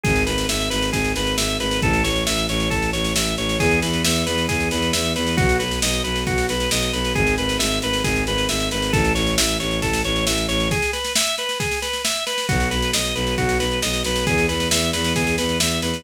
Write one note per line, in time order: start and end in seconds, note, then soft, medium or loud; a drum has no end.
0.04 0.24 G#1 loud
0.04 0.24 G#4 loud
0.04 kick medium
0.04 snare medium
0.16 snare medium
0.26 0.46 G#1 medium
0.26 0.46 B4 medium
0.26 snare medium
0.38 snare medium
0.49 0.68 G#1 medium
0.49 0.69 E5 medium
0.49 snare medium
0.60 snare medium
0.70 0.90 G#1 medium
0.70 0.90 B4 medium
0.70 snare medium
0.82 snare medium
0.92 1.12 G#1 medium
0.92 1.12 G#4 medium
0.92 kick medium
0.92 snare medium
1.04 snare medium
1.16 1.35 G#1 medium
1.16 1.36 B4 medium
1.16 snare medium
1.27 snare medium
1.38 1.57 G#1 medium
1.38 1.58 E5 medium
1.38 snare loud
1.49 snare medium
1.60 1.79 G#1 medium
1.60 1.80 B4 medium
1.60 snare medium
1.71 snare medium
1.82 2.01 A1 loud
1.82 2.03 A4 loud
1.82 kick medium
1.82 snare medium
1.93 snare medium
2.04 2.23 A1 medium
2.04 2.24 C#5 medium
2.04 snare medium
2.16 snare medium
2.26 2.46 A1 medium
2.26 2.46 E5 medium
2.26 snare medium
2.38 snare medium
2.49 2.68 A1 medium
2.49 2.69 C#5 medium
2.49 snare medium
2.60 snare medium
2.70 2.90 A1 medium
2.70 2.90 A4 loud
2.70 kick medium
2.70 snare medium
2.82 snare medium
2.93 3.12 A1 medium
2.93 3.13 C#5 medium
2.93 snare medium
3.05 snare medium
3.15 3.34 A1 medium
3.15 3.36 E5 medium
3.15 snare loud
3.27 snare medium
3.37 3.56 A1 medium
3.37 3.58 C#5 medium
3.37 snare medium
3.49 snare medium
3.60 3.78 E2 loud
3.60 3.80 G#4 loud
3.60 kick medium
3.60 snare medium
3.71 snare medium
3.82 4.01 E2 medium
3.82 4.02 B4 medium
3.82 snare medium
3.93 snare medium
4.04 4.24 E2 medium
4.04 4.24 E5 medium
4.04 snare loud
4.16 snare medium
4.26 4.46 E2 medium
4.26 4.46 B4 medium
4.26 snare medium
4.38 snare medium
4.49 4.68 E2 medium
4.49 4.69 G#4 loud
4.49 kick medium
4.49 snare medium
4.60 snare medium
4.71 4.90 E2 medium
4.71 4.92 B4 medium
4.71 snare medium
4.82 snare medium
4.93 5.13 E2 medium
4.93 5.13 E5 medium
4.93 snare loud
5.05 snare medium
5.16 5.35 E2 medium
5.16 5.36 B4 medium
5.16 snare medium
5.27 snare medium
5.37 5.57 B1 medium
5.37 5.57 F#4 loud
5.37 kick loud
5.37 snare medium
5.49 snare medium
5.59 5.79 B1 medium
5.59 5.79 B4 medium
5.59 snare medium
5.71 snare medium
5.82 6.01 B1 medium
5.82 6.03 D#5 medium
5.82 snare loud
5.93 snare medium
6.04 6.23 B1 medium
6.04 6.24 B4 medium
6.04 snare medium
6.16 snare medium
6.27 6.45 B1 medium
6.27 6.47 F#4 loud
6.27 kick medium
6.27 snare medium
6.38 snare medium
6.48 6.67 B1 medium
6.48 6.70 B4 medium
6.48 snare medium
6.60 snare medium
6.71 6.90 B1 medium
6.71 6.92 D#5 medium
6.71 snare loud
6.82 snare medium
6.93 7.12 B1 medium
6.93 7.13 B4 medium
6.93 snare medium
7.05 snare medium
7.15 7.35 G#1 loud
7.15 7.35 G#4 loud
7.15 kick medium
7.15 snare medium
7.27 snare medium
7.38 7.57 G#1 medium
7.38 7.58 B4 medium
7.38 snare medium
7.49 snare medium
7.59 7.79 G#1 medium
7.59 7.79 E5 medium
7.59 snare loud
7.71 snare medium
7.82 8.01 G#1 medium
7.82 8.03 B4 loud
7.82 snare medium
7.93 snare medium
8.04 8.23 G#1 loud
8.04 8.24 G#4 loud
8.04 kick medium
8.04 snare medium
8.16 snare medium
8.27 8.46 G#1 medium
8.27 8.48 B4 loud
8.27 snare medium
8.38 snare medium
8.49 8.68 G#1 medium
8.49 8.69 E5 medium
8.49 snare medium
8.60 snare medium
8.71 8.90 G#1 medium
8.71 8.92 B4 medium
8.71 snare medium
8.82 snare medium
8.93 9.12 A1 loud
8.93 9.13 A4 loud
8.93 kick medium
8.93 snare medium
9.04 snare medium
9.15 9.35 A1 medium
9.15 9.35 C#5 medium
9.15 snare medium
9.27 snare medium
9.38 9.57 A1 medium
9.38 9.58 E5 medium
9.38 snare loud
9.49 snare medium
9.60 9.79 A1 medium
9.60 9.80 C#5 medium
9.60 snare medium
9.71 snare medium
9.82 10.01 A1 medium
9.82 10.02 A4 loud
9.82 kick medium
9.82 snare medium
9.93 snare medium
10.05 10.24 A1 medium
10.05 10.25 C#5 loud
10.05 snare medium
10.16 snare medium
10.27 10.46 A1 medium
10.27 10.47 E5 medium
10.27 snare loud
10.38 snare medium
10.48 10.68 A1 medium
10.48 10.68 C#5 loud
10.48 snare medium
10.60 snare medium
10.71 10.91 G#4 loud
10.71 kick medium
10.71 snare medium
10.82 snare medium
10.93 11.13 B4 medium
10.93 snare medium
11.05 snare medium
11.16 11.36 E5 loud
11.16 snare loud
11.27 snare medium
11.38 11.58 B4 medium
11.38 snare medium
11.49 snare medium
11.60 11.80 G#4 medium
11.60 kick medium
11.60 snare medium
11.71 snare medium
11.82 12.02 B4 medium
11.82 snare medium
11.93 snare medium
12.05 12.25 E5 medium
12.05 snare loud
12.16 snare medium
12.26 12.46 B4 medium
12.26 snare medium
12.38 snare medium
12.49 12.68 B1 loud
12.49 12.69 F#4 loud
12.49 kick medium
12.49 snare medium
12.60 snare medium
12.71 12.90 B1 medium
12.71 12.91 B4 medium
12.71 snare medium
12.82 snare medium
12.93 13.12 B1 medium
12.93 13.14 D#5 medium
12.93 snare loud
13.05 snare medium
13.15 13.34 B1 loud
13.15 13.35 B4 medium
13.15 snare medium
13.27 snare medium
13.38 13.57 B1 medium
13.38 13.58 F#4 loud
13.38 kick medium
13.38 snare medium
13.49 snare medium
13.60 13.79 B1 medium
13.60 13.80 B4 medium
13.60 snare medium
13.71 snare soft
13.82 14.02 B1 medium
13.82 14.03 D#5 medium
13.82 snare medium
13.93 snare medium
14.04 14.23 B1 medium
14.04 14.26 B4 medium
14.04 snare medium
14.16 snare medium
14.27 14.46 E2 medium
14.27 14.47 G#4 loud
14.27 kick medium
14.27 snare medium
14.38 snare medium
14.49 14.68 E2 medium
14.49 14.69 B4 medium
14.49 snare medium
14.60 snare medium
14.71 14.90 E2 medium
14.71 14.91 E5 medium
14.71 snare loud
14.82 snare medium
14.93 15.13 E2 medium
14.93 15.13 B4 loud
14.93 snare medium
15.04 snare medium
15.16 15.35 E2 medium
15.16 15.36 G#4 loud
15.16 kick medium
15.16 snare medium
15.27 snare medium
15.38 15.57 E2 medium
15.38 15.58 B4 medium
15.38 snare medium
15.49 snare medium
15.60 15.79 E2 medium
15.60 15.80 E5 medium
15.60 snare loud
15.71 snare medium
15.82 16.01 E2 medium
15.82 16.03 B4 medium
15.82 snare medium
15.94 snare medium